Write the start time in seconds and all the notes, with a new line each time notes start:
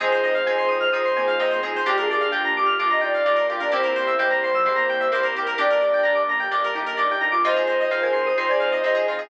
0.00 F2 G#3 C4 D#4 F4 G#4 C5
0.12 C5
0.23 F2 D#5
0.34 F5
0.46 F2 C4 D#4 F4 G#4 G#5
0.58 C6
0.68 F2 D#6
0.80 F6
0.92 F2 C4 D#4 F4 G#4 D#6
1.05 C6
1.16 F2 A#3 G#5
1.27 F5
1.39 F2 C4 D#4 F4 G#4 D#5
1.51 C5
1.63 F2 C4 G#4
1.75 G#3 C5
1.86 G1 A#3 D4 F4 G4
1.97 G#4 A#4
2.09 G1 G#4 D5
2.20 F5
2.32 G1 A#3 D4 F4 G4 G5
2.45 A#5
2.56 G1 G4 D6
2.66 F6
2.79 G1 A#3 D4 F4 G4 D6
2.91 D#5 A#5
3.01 G1 D#4 D5 G5
3.14 D5 F5
3.25 G1 A#3 D4 F4 G4 D5
3.36 A#4
3.49 G1 F4 G4 F5
3.60 D4 A#4 D5
3.71 C2 A#3 C4 E4 G4 C5
3.83 A#4
3.95 C2 C5
4.07 E5
4.18 C2 G#3 A#3 C4 E4 G4 G5
4.30 G3 A#5
4.42 C2 C6
4.54 F3 E6
4.65 C2 G#3 A#3 C4 E4 G4 C6
4.76 A#3 A#5
4.89 C2 G5
5.00 E5
5.12 C2 A#3 C4 E4 G4 A#4 C5
5.23 A#4
5.35 C2 G4
5.46 A#4
5.58 G1 A#3 D4 G4 D5
5.70 A#4
5.81 G1 D5
5.93 G5
6.03 G1 A#3 D4 G4 A#5
6.15 D6
6.28 G1 A#5
6.40 G5
6.51 G1 A#3 D4 G4 D5
6.64 A#4
6.74 G1 D#4 G4
6.86 A#4
6.97 G1 A#3 D4 G4 D5
7.11 G5
7.21 G1 D#4 A#5
7.32 F4 D6
7.44 F2 C4 D#4 F4 G#4 C5 D#5
7.56 G#4
7.67 F2 C5
7.80 D#5
7.91 F2 C4 D#4 F4 G#4 C5 F5
8.02 A#4 G#5
8.13 F2 C6
8.26 G#4 D#6
8.37 F2 C4 D#4 F4 G#4 C5 C6
8.49 D5 G#5
8.60 F2 F5
8.72 D#5
8.83 F2 C4 D#4 F4 G#4 C5 D#5
8.94 G#4
9.07 F2 F4
9.18 G#4